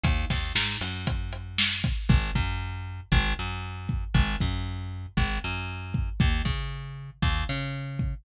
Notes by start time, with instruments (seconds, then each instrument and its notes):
0.04 electric bass (finger) D#2, kick, closed hi-hat
0.30 electric bass (finger) D#2, kick, snare, closed hi-hat
0.55 electric bass (finger) G#2, snare
0.81 electric bass (finger) F#2, closed hi-hat
1.07 kick, closed hi-hat
1.33 closed hi-hat
1.58 snare
1.84 kick, closed hi-hat
2.09 electric bass (finger) G#1, kick
2.35 electric bass (finger) F#2, kick
3.12 electric bass (finger) G#1, kick
3.39 electric bass (finger) F#2
3.89 kick
4.14 electric bass (finger) G#1, kick
4.40 electric bass (finger) F#2, kick
5.17 electric bass (finger) G#1, kick
5.44 electric bass (finger) F#2
5.94 kick
6.20 electric bass (finger) D#2, kick
6.45 electric bass (finger) C#3, kick
7.22 electric bass (finger) D#2, kick
7.49 electric bass (finger) C#3
7.99 kick